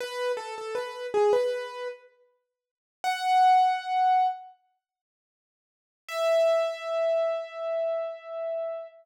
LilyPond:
\new Staff { \time 4/4 \key e \major \tempo 4 = 79 b'8 a'16 a'16 b'8 gis'16 b'8. r4. | fis''2 r2 | e''1 | }